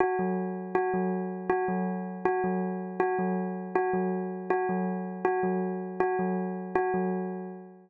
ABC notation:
X:1
M:5/4
L:1/8
Q:1/4=160
K:none
V:1 name="Tubular Bells"
^F ^F, z2 F F, z2 F F, | z2 ^F ^F, z2 F F, z2 | ^F ^F, z2 F F, z2 F F, | z2 ^F ^F, z2 F F, z2 |]